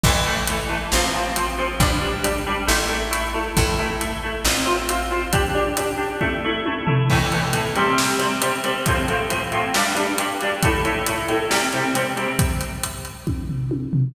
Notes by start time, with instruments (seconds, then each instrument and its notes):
0.03 electric bass (finger) A1, acoustic guitar (steel) E3 A3, kick, crash
0.26 acoustic guitar (steel) E3 A3
0.47 acoustic guitar (steel) E3 A3, closed hi-hat
0.69 acoustic guitar (steel) E3 A3
0.92 electric bass (finger) A1, acoustic guitar (steel) F3 C4, snare
1.14 acoustic guitar (steel) F3 C4
1.36 acoustic guitar (steel) F3 C4, closed hi-hat
1.58 acoustic guitar (steel) F3 C4
1.80 electric bass (finger) A1, acoustic guitar (steel) G3 D4, kick, closed hi-hat
2.02 acoustic guitar (steel) G3 D4
2.23 acoustic guitar (steel) G3 D4, closed hi-hat
2.47 acoustic guitar (steel) G3 D4
2.67 electric bass (finger) A1, acoustic guitar (steel) A3 E4, snare
2.89 acoustic guitar (steel) A3 E4
3.11 acoustic guitar (steel) A3 E4, closed hi-hat
3.34 acoustic guitar (steel) A3 E4
3.57 electric bass (finger) A1, acoustic guitar (steel) A3 E4, kick, closed hi-hat
3.79 acoustic guitar (steel) A3 E4
4.00 acoustic guitar (steel) A3 E4, closed hi-hat
4.23 acoustic guitar (steel) A3 E4
4.45 electric bass (finger) A1, acoustic guitar (steel) C4 F4, snare
4.66 acoustic guitar (steel) C4 F4
4.89 acoustic guitar (steel) C4 F4, closed hi-hat
5.11 acoustic guitar (steel) C4 F4
5.33 acoustic guitar (steel) D4 G4, kick, closed hi-hat
5.55 acoustic guitar (steel) D4 G4
5.77 acoustic guitar (steel) D4 G4, closed hi-hat
5.98 acoustic guitar (steel) D4 G4
6.21 acoustic guitar (steel) A3 E4, kick, high tom
6.44 acoustic guitar (steel) A3 E4
6.66 acoustic guitar (steel) A3 E4, high tom
6.86 acoustic guitar (steel) A3 E4, floor tom
7.10 acoustic guitar (steel) A2 E3 A3, kick, crash
7.32 acoustic guitar (steel) A2 E3 A3, closed hi-hat
7.53 acoustic guitar (steel) A2 E3 A3, closed hi-hat
7.75 acoustic guitar (steel) C3 G3 C4, closed hi-hat
7.98 snare
8.19 acoustic guitar (steel) C3 G3 C4, closed hi-hat
8.41 acoustic guitar (steel) C3 G3 C4, closed hi-hat
8.63 acoustic guitar (steel) C3 G3 C4, closed hi-hat
8.86 acoustic guitar (steel) A2 F3 C4, kick, closed hi-hat
9.08 acoustic guitar (steel) A2 F3 C4, closed hi-hat
9.30 acoustic guitar (steel) A2 F3 C4, closed hi-hat
9.52 acoustic guitar (steel) A2 F3 C4, closed hi-hat
9.74 acoustic guitar (steel) G2 G3 D4, snare
9.95 acoustic guitar (steel) G2 G3 D4, closed hi-hat
10.18 acoustic guitar (steel) G2 G3 D4, closed hi-hat
10.41 acoustic guitar (steel) G2 G3 D4, closed hi-hat
10.63 acoustic guitar (steel) A2 A3 E4, kick, closed hi-hat
10.85 acoustic guitar (steel) A2 A3 E4, closed hi-hat
11.06 acoustic guitar (steel) A2 A3 E4, closed hi-hat
11.28 acoustic guitar (steel) A2 A3 E4, closed hi-hat
11.50 acoustic guitar (steel) C3 G3 C4, snare
11.73 acoustic guitar (steel) C3 G3 C4, closed hi-hat
11.94 acoustic guitar (steel) C3 G3 C4, closed hi-hat
12.16 acoustic guitar (steel) C3 G3 C4, closed hi-hat
12.39 kick, closed hi-hat
12.61 closed hi-hat
12.83 closed hi-hat
13.05 closed hi-hat
13.27 kick, high tom
13.49 floor tom
13.71 high tom
13.93 floor tom